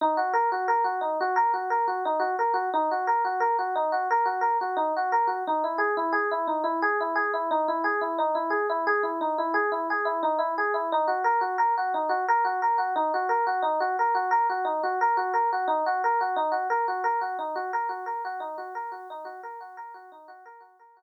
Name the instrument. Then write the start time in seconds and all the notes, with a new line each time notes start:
electric piano 1
0.01 D#4
0.17 F#4
0.33 A#4
0.52 F#4
0.68 A#4
0.84 F#4
1.01 D#4
1.20 F#4
1.36 A#4
1.53 F#4
1.70 A#4
1.87 F#4
2.05 D#4
2.19 F#4
2.39 A#4
2.54 F#4
2.73 D#4
2.91 F#4
3.07 A#4
3.25 F#4
3.40 A#4
3.59 F#4
3.75 D#4
3.92 F#4
4.11 A#4
4.25 F#4
4.41 A#4
4.61 F#4
4.76 D#4
4.96 F#4
5.12 A#4
5.27 F#4
5.47 D#4
5.64 E4
5.78 G#4
5.97 E4
6.12 G#4
6.31 E4
6.47 D#4
6.64 E4
6.82 G#4
7.00 E4
7.15 G#4
7.34 E4
7.51 D#4
7.68 E4
7.84 G#4
8.01 E4
8.18 D#4
8.35 E4
8.50 G#4
8.69 E4
8.87 G#4
9.03 E4
9.21 D#4
9.38 E4
9.54 G#4
9.72 E4
9.90 G#4
10.05 E4
10.23 D#4
10.38 E4
10.58 G#4
10.74 E4
10.92 D#4
11.08 F#4
11.24 A#4
11.41 F#4
11.58 A#4
11.77 F#4
11.94 D#4
12.09 F#4
12.28 A#4
12.45 F#4
12.62 A#4
12.78 F#4
12.96 D#4
13.14 F#4
13.29 A#4
13.47 F#4
13.62 D#4
13.80 F#4
13.99 A#4
14.15 F#4
14.31 A#4
14.49 F#4
14.65 D#4
14.83 F#4
15.01 A#4
15.17 F#4
15.33 A#4
15.52 F#4
15.67 D#4
15.86 F#4
16.04 A#4
16.21 F#4
16.36 D#4
16.52 F#4
16.70 A#4
16.88 F#4
17.04 A#4
17.21 F#4
17.39 D#4
17.55 F#4
17.73 A#4
17.89 F#4
18.06 A#4
18.25 F#4
18.40 D#4
18.58 F#4
18.75 A#4
18.92 F#4
19.10 D#4
19.25 F#4
19.43 A#4
19.61 F#4
19.77 A#4
19.94 F#4
20.12 D#4
20.28 F#4
20.45 A#4
20.60 F#4
20.79 A#4
20.97 F#4